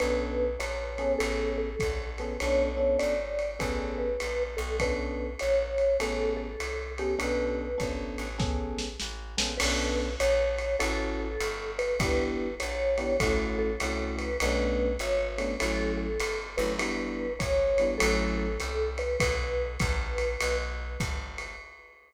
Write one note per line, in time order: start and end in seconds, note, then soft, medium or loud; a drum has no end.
0.00 0.57 B1 medium
0.00 0.45 B3 medium
0.00 0.45 C#4 medium
0.00 0.45 D4 medium
0.00 0.45 A4 medium
0.00 0.56 B4 medium
0.00 ride medium
0.59 1.16 A#1 medium
0.59 1.12 C#5 medium
0.59 hi-hat pedal medium
0.59 ride medium
0.98 1.67 B3 medium
0.98 1.67 C#4 loud
0.98 1.67 G#4 medium
0.98 1.67 A4 medium
0.98 ride medium
1.19 1.76 A1 loud
1.19 1.50 A4 medium
1.19 ride medium
1.58 2.09 A4 medium
1.79 2.38 A#1 medium
1.79 kick medium
1.79 hi-hat pedal medium
1.79 ride medium
2.18 2.35 B3 medium
2.18 2.35 C#4 medium
2.18 2.35 G#4 medium
2.18 2.35 A4 medium
2.18 2.38 B4 medium
2.18 ride medium
2.40 2.97 B1 medium
2.40 2.69 B3 medium
2.40 2.69 C#4 medium
2.40 2.69 D4 loud
2.40 2.69 A4 medium
2.40 2.97 C#5 loud
2.40 ride medium
2.77 3.14 B3 medium
2.77 3.14 C#4 medium
2.77 3.14 D4 medium
2.77 3.14 A4 medium
2.99 3.58 G#1 medium
2.99 3.55 D5 medium
2.99 hi-hat pedal medium
2.99 ride medium
3.39 ride medium
3.59 4.17 A1 medium
3.59 4.06 B3 medium
3.59 4.06 C#4 medium
3.59 4.06 G#4 medium
3.59 4.06 A4 medium
3.59 3.97 B4 medium
3.59 kick soft
3.59 ride medium
3.98 4.43 B4 medium
4.20 4.58 A#1 medium
4.20 hi-hat pedal medium
4.20 ride medium
4.57 5.36 B1 loud
4.57 4.76 A4 medium
4.57 ride medium
4.80 5.27 B3 medium
4.80 5.27 C#4 medium
4.80 5.27 D4 medium
4.80 5.27 A4 medium
4.80 5.33 B4 medium
4.80 kick soft
4.80 ride medium
5.39 5.98 A#1 medium
5.39 5.97 C#5 medium
5.39 hi-hat pedal medium
5.39 ride medium
5.78 ride medium
6.00 6.56 A1 medium
6.00 6.47 B3 medium
6.00 6.47 C#4 medium
6.00 6.47 G#4 medium
6.00 6.47 A4 medium
6.00 6.33 A4 medium
6.00 ride medium
6.37 6.92 A4 medium
6.60 7.16 C2 medium
6.60 hi-hat pedal medium
6.60 ride medium
6.98 7.14 B3 medium
6.98 7.14 C#4 medium
6.98 7.19 G4 medium
6.98 7.14 G#4 medium
6.98 7.14 A4 medium
6.98 ride medium
7.19 7.75 B1 medium
7.19 7.66 B3 medium
7.19 7.66 C#4 medium
7.19 7.66 D4 medium
7.19 7.66 A4 medium
7.19 7.95 B4 medium
7.19 ride medium
7.78 8.17 G#1 medium
7.78 8.25 B3 medium
7.78 8.25 C#4 medium
7.78 8.25 D4 medium
7.78 8.25 A4 medium
7.78 kick soft
7.78 hi-hat pedal medium
7.78 ride medium
8.18 8.96 A1 medium
8.18 ride medium
8.38 8.86 B3 medium
8.38 8.86 C#4 medium
8.38 8.86 G#4 medium
8.38 8.86 A4 medium
8.38 kick medium
8.38 snare medium
8.79 snare medium
9.00 9.36 A1 medium
9.00 snare medium
9.37 9.59 A#1 medium
9.37 9.53 B3 medium
9.37 9.53 C#4 medium
9.37 9.53 G#4 medium
9.37 9.53 A4 medium
9.37 snare medium
9.58 10.16 B1 loud
9.58 10.07 B3 loud
9.58 10.07 C#4 loud
9.58 10.07 D4 loud
9.58 10.07 A4 medium
9.58 10.14 B4 loud
9.58 crash loud
9.58 ride loud
10.20 10.76 A#1 loud
10.20 10.76 C#5 loud
10.20 hi-hat pedal medium
10.20 ride medium
10.58 ride medium
10.79 11.37 A1 loud
10.79 11.27 C#4 loud
10.79 11.27 E4 loud
10.79 11.27 F#4 loud
10.79 11.15 A4 loud
10.79 11.27 A4 loud
10.79 ride medium
11.20 11.71 A4 loud
11.40 11.96 G1 loud
11.40 hi-hat pedal medium
11.40 ride medium
11.79 11.98 B4 loud
11.79 ride medium
11.99 12.55 G1 loud
11.99 12.47 B3 loud
11.99 12.47 D4 medium
11.99 12.47 E4 loud
11.99 12.47 G4 loud
11.99 12.55 B4 loud
11.99 kick medium
11.99 ride medium
12.60 13.18 A#1 medium
12.60 13.16 C#5 medium
12.60 hi-hat pedal medium
12.60 ride medium
12.98 13.13 B3 medium
12.98 13.13 D4 medium
12.98 13.13 E4 medium
12.98 13.13 G4 medium
12.98 ride medium
13.20 13.76 A1 loud
13.20 13.69 A3 loud
13.20 13.69 C#4 medium
13.20 13.69 E4 loud
13.20 13.69 F#4 medium
13.20 13.56 A4 loud
13.20 kick medium
13.20 ride medium
13.59 14.15 A4 loud
13.80 14.37 C2 medium
13.80 14.28 A3 medium
13.80 14.28 C#4 medium
13.80 14.28 E4 medium
13.80 14.28 F#4 medium
13.80 hi-hat pedal medium
13.80 ride medium
14.18 14.37 B4 loud
14.18 ride medium
14.40 14.97 B1 loud
14.40 14.89 A3 loud
14.40 14.89 B3 loud
14.40 14.89 C#4 loud
14.40 14.89 D4 loud
14.40 14.97 B4 loud
14.40 ride loud
14.99 15.56 G#1 loud
14.99 15.55 C#5 loud
14.99 hi-hat pedal medium
14.99 ride medium
15.38 15.53 A3 loud
15.38 15.53 B3 medium
15.38 15.53 C#4 medium
15.38 15.53 D4 medium
15.38 ride medium
15.60 16.18 A1 loud
15.60 16.07 F#3 medium
15.60 16.07 A3 medium
15.60 16.07 C#4 loud
15.60 16.07 E4 loud
15.60 15.92 A4 loud
15.60 ride medium
15.97 16.46 A4 loud
16.20 16.57 G1 medium
16.20 hi-hat pedal medium
16.20 ride medium
16.57 17.36 G1 loud
16.57 16.73 F#3 medium
16.57 16.73 A3 medium
16.57 16.73 C#4 medium
16.57 16.73 E4 medium
16.57 16.76 B4 medium
16.57 ride medium
16.78 17.25 G3 loud
16.78 17.25 B3 loud
16.78 17.25 D4 loud
16.78 17.25 E4 loud
16.78 17.33 B4 loud
16.78 ride medium
17.39 17.97 G#1 medium
17.39 17.97 C#5 medium
17.39 kick medium
17.39 hi-hat pedal medium
17.39 ride medium
17.78 17.95 G3 medium
17.78 17.95 B3 medium
17.78 17.95 D4 medium
17.78 17.95 E4 medium
17.78 ride medium
17.98 18.57 A1 loud
17.98 18.46 F#3 loud
17.98 18.46 A3 loud
17.98 18.46 C#4 loud
17.98 18.46 E4 loud
17.98 18.30 A4 loud
17.98 ride loud
18.38 18.90 A4 medium
18.60 19.17 C2 medium
18.60 hi-hat pedal medium
18.60 ride medium
18.98 19.16 B4 loud
18.98 ride medium
19.20 19.77 B1 loud
19.20 20.57 B4 loud
19.20 kick medium
19.20 ride loud
19.80 20.37 A#1 loud
19.80 kick medium
19.80 hi-hat pedal medium
19.80 ride medium
20.18 ride medium
20.41 20.97 B1 loud
20.41 ride loud
21.00 21.56 G1 medium
21.00 kick medium
21.00 hi-hat pedal medium
21.00 ride medium
21.38 ride medium